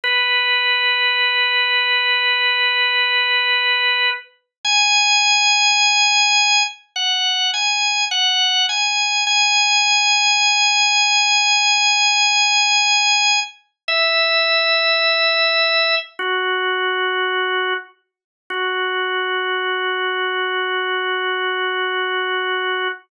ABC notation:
X:1
M:4/4
L:1/8
Q:1/4=52
K:B
V:1 name="Drawbar Organ"
B8 | g4 f g f g | g8 | e4 F3 z |
F8 |]